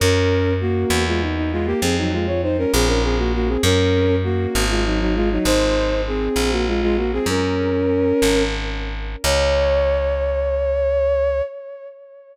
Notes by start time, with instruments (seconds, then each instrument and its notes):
0.00 electric bass (finger) F#2, violin C#4 A#4
0.61 violin A#3 F#4
0.90 electric bass (finger) E2
1.07 violin G#3 F4
1.21 violin D#4
1.37 violin D#4
1.52 violin G#3 F4
1.66 violin A#3 G4
1.82 electric bass (finger) F2, violin C4 G#4
1.98 violin F#3 D#4
2.13 violin G#3 F4
2.27 violin F4 C#5
2.42 violin D#4 C5
2.58 violin C#4 A#4
2.73 electric bass (finger) A#1, violin C4 G#4
2.87 violin C#4 A#4
3.03 violin C4 G#4
3.18 violin A#3 F#4
3.34 violin A#3 F#4
3.48 violin C4 G#4
3.63 electric bass (finger) F#2, violin C#4 A#4
4.24 violin A#3 F#4
4.55 electric bass (finger) G#1
4.69 violin G#3 F4
4.85 violin F#3 D#4
5.00 violin F#3 D#4
5.15 violin G#3 F4
5.31 violin F#3 D#4
5.45 electric bass (finger) G#1, violin D#4 C5
6.07 violin C4 G#4
6.36 electric bass (finger) A#1
6.51 violin A#3 F#4
6.67 violin G#3 F4
6.82 violin G#3 F4
6.97 violin A#3 F#4
7.13 violin C4 G#4
7.26 electric bass (finger) F#2, violin C#4 A#4
8.22 electric bass (finger) G#1
9.24 electric bass (finger) C#2, violin C#5